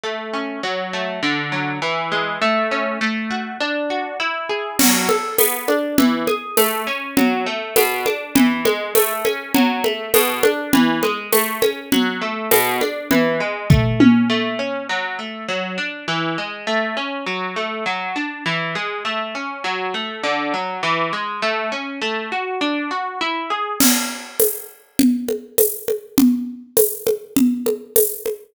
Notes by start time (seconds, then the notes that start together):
0.04 A3
0.34 C#4
0.63 F#3
0.93 A3
1.23 D3
1.52 F#3
1.82 E3
2.12 G#3
2.42 A3
2.71 C#4
3.01 A3
3.31 F#4
3.61 D4
3.90 F#4
4.20 E4
4.50 G#4
4.79 F#3, crash, low conga
5.09 A4, high conga
5.38 B3, tambourine, high conga
5.68 D4, high conga
5.98 E3, low conga
6.27 G#4, high conga
6.57 A3, tambourine, high conga
6.87 C#4
7.17 F#3, low conga
7.46 A3
7.76 B2, tambourine, high conga
8.06 D4, high conga
8.35 E3, low conga
8.65 G#3, high conga
8.95 A3, tambourine, high conga
9.25 C#4, high conga
9.54 F#3, low conga
9.84 A3, high conga
10.14 B2, tambourine, high conga
10.43 D4, high conga
10.73 E3, low conga
11.03 G#3, high conga
11.33 A3, tambourine, high conga
11.62 C#4, high conga
11.92 F#3, low conga
12.22 A3
12.51 B2, tambourine, high conga
12.81 D4, high conga
13.11 E3, low conga
13.40 G#3
13.70 A3, kick, floor tom
14.00 C#4, high tom
14.30 A3
14.59 C#4
14.89 F#3
15.19 A3
15.49 F#3
15.78 D4
16.08 E3
16.38 G#3
16.67 A3
16.97 C#4
17.26 F#3
17.56 A3
17.86 F#3
18.16 D4
18.46 E3
18.75 G#3
19.05 A3
19.35 C#4
19.64 F#3
19.94 A3
20.24 D3
20.54 F#3
20.83 E3
21.13 G#3
21.42 A3
21.72 C#4
22.02 A3
22.32 F#4
22.61 D4
22.91 F#4
23.21 E4
23.50 G#4
23.80 crash, low conga
24.40 tambourine, high conga
24.99 low conga
25.29 high conga
25.58 tambourine, high conga
25.88 high conga
26.18 low conga
26.77 tambourine, high conga
27.07 high conga
27.37 low conga
27.66 high conga
27.96 tambourine, high conga
28.26 high conga